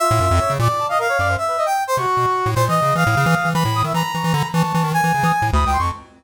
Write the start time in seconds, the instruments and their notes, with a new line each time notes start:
0.00 brass section F4 E5
0.11 lead 1 (square) A2
0.21 lead 1 (square) F#2
0.31 lead 1 (square) F2
0.39 brass section C#5
0.50 lead 1 (square) C#3
0.59 lead 1 (square) A#2, brass section D5
0.79 brass section A5
0.89 brass section D#5 F5
0.99 brass section A#4 F5
1.09 brass section C#5
1.19 lead 1 (square) F#2, brass section D5
1.28 brass section C5
1.37 brass section E5
1.48 brass section B4
1.58 brass section D#5
1.66 brass section G5
1.87 brass section C5
1.97 lead 1 (square) C3, brass section F#4 C#6
2.17 lead 1 (square) B2
2.46 lead 1 (square) A2
2.56 lead 1 (square) A#2, brass section C5
2.68 lead 1 (square) E3, brass section D#5
2.82 lead 1 (square) C#3
2.95 lead 1 (square) E3, brass section F5 D#6
3.07 lead 1 (square) A2
3.17 lead 1 (square) C#3
3.26 lead 1 (square) E3
3.45 lead 1 (square) E3
3.54 lead 1 (square) E3, brass section B5
3.65 lead 1 (square) A2
3.75 brass section D#6
3.84 lead 1 (square) D#3, brass section E5
3.94 lead 1 (square) E3, brass section A#5 B5
4.14 lead 1 (square) E3, brass section C#6
4.24 lead 1 (square) E3
4.34 lead 1 (square) D3, brass section B5
4.52 lead 1 (square) E3, brass section A5 C#6
4.64 lead 1 (square) E3
4.74 lead 1 (square) E3
4.84 lead 1 (square) D#3
4.93 lead 1 (square) E3, brass section G#5
5.04 lead 1 (square) E3
5.14 lead 1 (square) C#3
5.23 lead 1 (square) E3, brass section D#6
5.42 lead 1 (square) A2
5.52 lead 1 (square) D2, brass section B5 D#6
5.66 lead 1 (square) C#2, brass section G5
5.73 brass section C6
5.77 lead 1 (square) F2, brass section C#6
5.82 brass section A5